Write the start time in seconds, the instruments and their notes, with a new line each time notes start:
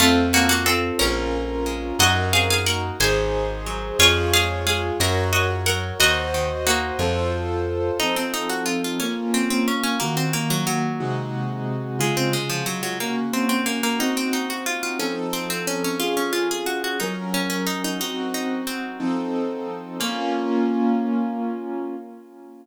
0.00 electric bass (finger) F2, harpsichord A3 F4, acoustic grand piano C4 F4 A4
0.33 harpsichord A#3 C#4 F#4
0.49 harpsichord A#3 F#4
0.66 harpsichord C4 A4
0.99 electric bass (finger) A#1, harpsichord A#3 C#4 A#4, acoustic grand piano C#4 F4 A#4
1.66 harpsichord G#3
1.99 electric bass (finger) F#2, acoustic grand piano D#4 F#4 A#4, harpsichord F#4 D#5
2.33 harpsichord C4 G#4 F5
2.50 harpsichord G#4 F5
2.66 harpsichord A#3 A#4 F#5
3.00 electric bass (finger) G#1, harpsichord G#3 C5 G#5, acoustic grand piano D#4 G#4 C5
3.66 harpsichord F#3
3.99 electric bass (finger) F2, harpsichord F4 C#5, acoustic grand piano F4 G#4 C#5
4.33 harpsichord G#3 G#4 F5
4.67 harpsichord G#3 G#4 F5
5.00 electric bass (finger) F#2, harpsichord F#3 A#4 F#5, acoustic grand piano F#4 A#4 C#5
5.33 harpsichord F#4 D#5
5.66 harpsichord F#3 A#4 F#5
6.00 electric bass (finger) D#2, harpsichord D#3 F#4 D#5, acoustic grand piano F#4 C5 D#5
6.34 harpsichord D#3
6.67 harpsichord A#3 D#4 F#4
6.99 electric bass (finger) F2, acoustic grand piano F4 A4 C5
8.00 acoustic grand piano F3 C4 D#4 A4, harpsichord D#4
8.16 harpsichord C4
8.34 harpsichord D#4
8.49 harpsichord F#4
8.66 harpsichord F4
8.84 harpsichord F4
9.00 acoustic grand piano A#3 C#4 F4, harpsichord C#4
9.34 harpsichord C4
9.50 harpsichord C4
9.68 harpsichord C#4
9.83 harpsichord C#4
10.00 acoustic grand piano D#3 A#3 F#4, harpsichord A#3
10.17 harpsichord C4
10.33 harpsichord A#3
10.50 harpsichord F#3
10.67 harpsichord F#3
11.00 acoustic grand piano C3 G#3 D#4 F#4
11.99 acoustic grand piano C#3 G#3 F4, harpsichord G#3
12.17 harpsichord C4
12.33 harpsichord G#3
12.50 harpsichord F3
12.66 harpsichord F#3
12.83 harpsichord F#3
13.00 acoustic grand piano A#3 C#4 F#4, harpsichord A#3
13.33 harpsichord C4
13.49 harpsichord C4
13.66 harpsichord A#3
13.83 harpsichord A#3
13.99 acoustic grand piano C4 D#4 F#4, harpsichord D#4
14.17 harpsichord C4
14.33 harpsichord D#4
14.50 harpsichord F#4
14.66 harpsichord F4
14.83 harpsichord F4
14.99 acoustic grand piano F3 C4 D#4 A4, harpsichord C#4
15.33 harpsichord C4
15.50 harpsichord C4
15.67 harpsichord C#4
15.84 harpsichord C#4
16.00 acoustic grand piano C#4 F4 G#4, harpsichord F4
16.17 harpsichord C#4
16.33 harpsichord F4
16.51 harpsichord G#4
16.66 harpsichord F#4
16.84 harpsichord F#4
17.00 acoustic grand piano F#3 C#4 A#4, harpsichord D#4
17.34 harpsichord C#4
17.50 harpsichord C#4
17.67 harpsichord D#4
17.84 harpsichord D#4
17.99 acoustic grand piano C4 D#4 F#4, harpsichord D#4
18.34 harpsichord D#4
18.67 harpsichord C4
19.00 acoustic grand piano F3 C4 D#4 A4
20.00 acoustic grand piano A#3 C#4 F4, harpsichord A#3